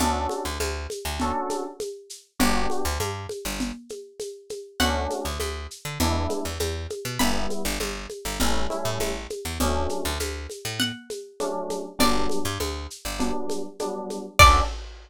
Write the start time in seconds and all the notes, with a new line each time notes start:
0.00 D2 C#4 D4 F#4 A4, low conga, shaker
0.29 high conga, shaker
0.45 D2
0.60 D2, high conga, shaker
0.90 high conga, shaker
1.05 D2
1.20 C#4 D4 F#4 A4, low conga, shaker
1.50 high conga, shaker
1.80 high conga, shaker
2.10 shaker
2.39 G1 B3 D4 F#4 G4, low conga, shaker
2.70 high conga, shaker
2.85 D2
3.00 G2, high conga, shaker
3.29 high conga, shaker
3.45 G1
3.60 low conga, shaker
3.89 high conga, shaker
4.20 high conga, shaker
4.50 high conga, shaker
4.80 D2 A3 C#4 D4 F#4 F#5, low conga, shaker
5.10 high conga, shaker
5.25 D2
5.40 D2, high conga, shaker
5.71 shaker
5.85 D3
6.00 E2 G#3 B3 D4 E4, low conga, shaker
6.30 high conga, shaker
6.45 E2
6.59 E2, high conga, shaker
6.90 high conga, shaker
7.05 B2
7.19 G1 G3 B3 E4 B5, low conga, shaker
7.50 high conga, shaker
7.65 G1
7.80 G1, high conga, shaker
8.10 high conga, shaker
8.25 G1
8.39 A1 G3 A3 C#4 E4, low conga, shaker
8.70 G3 A3 C#4 E4, high conga, shaker
8.85 A2
9.00 A1, high conga, shaker
9.30 high conga, shaker
9.45 E2
9.60 D2 F#3 A3 C#4 D4, low conga, shaker
9.89 high conga, shaker
10.05 D2
10.20 D2, high conga, shaker
10.50 high conga, shaker
10.65 A2
10.80 F#5, low conga, shaker
11.10 high conga, shaker
11.40 F#3 A3 C#4 D4, high conga, shaker
11.70 high conga, shaker
11.99 G1 F#3 G3 B3 D4 D5, low conga, shaker
12.29 high conga, shaker
12.45 G2
12.60 D2, high conga, shaker
12.90 shaker
13.05 G1
13.19 F#3 G3 B3 D4, low conga, shaker
13.50 high conga, shaker
13.79 F#3 G3 B3 D4, high conga, shaker
14.10 high conga, shaker
14.39 D2 C#4 D4 F#4 A4 D5, kick, crash